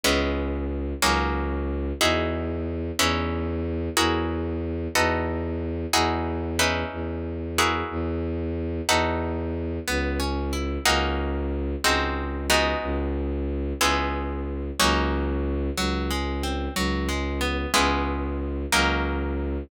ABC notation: X:1
M:6/8
L:1/8
Q:3/8=61
K:C#m
V:1 name="Acoustic Guitar (steel)"
[G,B,CE]3 [F,^A,CD]3 | [K:E] [DEFG]3 [CDEB]3 | [EFG^A]3 [DF=AB]3 | [DEFG]2 [CDEB]3 [EFG^A]- |
[EFG^A]3 [DF=AB]3 | [K:C#m] B, C E [^A,CDF]3 | [G,^B,DF]2 [G,=B,DF]4 | [G,B,CE]3 [F,^A,CD]3 |
F, G, ^B, F, G, =B, | [G,B,CE]3 [F,^A,CD]3 |]
V:2 name="Violin" clef=bass
C,,3 C,,3 | [K:E] E,,3 E,,3 | E,,3 E,,3 | E,,3 E,,3 |
E,,3 E,,3 | [K:C#m] C,,3 C,,3 | C,,3 C,,3 | C,,3 C,,3 |
C,,3 C,,3 | C,,3 C,,3 |]